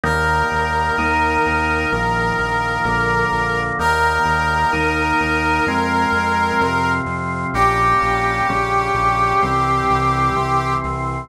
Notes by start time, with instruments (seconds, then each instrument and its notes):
0.04 synth bass 1 D#2, drawbar organ D#3 G3 A#3, brass section A#4
0.52 synth bass 1 D#2
0.98 synth bass 1 D#2, drawbar organ D#3 A#3 D#4
1.46 synth bass 1 D#2
1.92 synth bass 1 A#1, drawbar organ D#3 F3 A#3
2.39 synth bass 1 A#1
2.85 synth bass 1 A#1, drawbar organ D3 F3 A#3
3.32 synth bass 1 A#1
3.79 synth bass 1 D#2, drawbar organ D#3 G3 A#3, brass section A#4
4.26 synth bass 1 D#2
4.73 synth bass 1 D#2, drawbar organ D#3 A#3 D#4
5.21 synth bass 1 D#2
5.67 synth bass 1 F2, drawbar organ F3 G#3 C4
6.12 synth bass 1 F2
6.61 synth bass 1 F2, drawbar organ C3 F3 C4
7.06 synth bass 1 F2
7.54 synth bass 1 A#1, drawbar organ G3 A#3 C#4, brass section G4
8.02 synth bass 1 A#1
8.49 synth bass 1 A#1, drawbar organ C#3 G3 C#4
8.94 synth bass 1 A#1
9.42 synth bass 1 C2, drawbar organ E3 G3 C4
9.90 synth bass 1 C2
10.36 synth bass 1 C2, drawbar organ C3 E3 C4
10.84 synth bass 1 C2